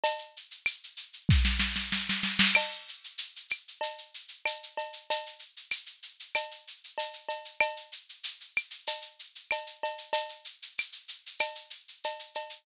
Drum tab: CC |----------------|x---------------|----------------|----------------|
SH |xxxxxxxx--------|-xxxxxxxxxxxxxxx|xxxxxxxxxxxxxxxx|xxxxxxxxxxxxxxxx|
CB |x---------------|x-------x---x-x-|x-------x---x-x-|x-------x---x-x-|
CL |----x-----------|x-----x-----x---|----x---x-------|x-----x-----x---|
SD |--------oooooooo|----------------|----------------|----------------|
BD |--------o-------|----------------|----------------|----------------|

CC |----------------|
SH |xxxxxxxxxxxxxxxx|
CB |x-------x---x-x-|
CL |----x---x-------|
SD |----------------|
BD |----------------|